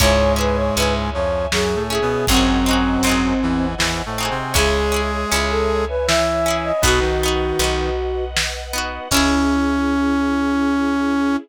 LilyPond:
<<
  \new Staff \with { instrumentName = "Flute" } { \time 3/4 \key cis \minor \tempo 4 = 79 cis''8 b'16 cis''16 b'16 r16 cis''8 gis'8 gis'8 | bis2 r4 | gis'8. gis'16 r16 a'8 b'16 e''8. dis''16 | fis'2 r4 |
cis'2. | }
  \new Staff \with { instrumentName = "Brass Section" } { \time 3/4 \key cis \minor <gis, gis>4. <f, eis>8 \tuplet 3/2 { <fis, fis>8 <a, a>8 <b, b>8 } | <fis, fis>4. <e, e>8 \tuplet 3/2 { <e, e>8 <a, a>8 <bis, bis>8 } | <gis gis'>2 <e e'>4 | <b, b>16 <dis dis'>4~ <dis dis'>16 r4. |
cis'2. | }
  \new Staff \with { instrumentName = "Orchestral Harp" } { \time 3/4 \key cis \minor <cis' e' gis'>8 <cis' e' gis'>8 <cis' e' gis'>4. <cis' e' gis'>8 | <bis dis' fis' gis'>8 <bis dis' fis' gis'>8 <bis dis' fis' gis'>4. <bis dis' fis' gis'>8 | <cis' e' gis'>8 <cis' e' gis'>8 <cis' e' gis'>4. <cis' e' gis'>8 | <b dis' fis'>8 <b dis' fis'>8 <b dis' fis'>4. <b dis' fis'>8 |
<cis' e' gis'>2. | }
  \new Staff \with { instrumentName = "Electric Bass (finger)" } { \clef bass \time 3/4 \key cis \minor cis,4 cis,2 | gis,,4 gis,,2 | cis,4 cis,2 | b,,4 b,,2 |
cis,2. | }
  \new Staff \with { instrumentName = "String Ensemble 1" } { \time 3/4 \key cis \minor <cis'' e'' gis''>2. | <bis' dis'' fis'' gis''>2. | <cis'' e'' gis''>2. | <b' dis'' fis''>2. |
<cis' e' gis'>2. | }
  \new DrumStaff \with { instrumentName = "Drums" } \drummode { \time 3/4 <hh bd>4 hh4 sn4 | <hh bd>4 hh4 sn4 | <hh bd>4 hh4 sn4 | <hh bd>4 hh4 sn4 |
<cymc bd>4 r4 r4 | }
>>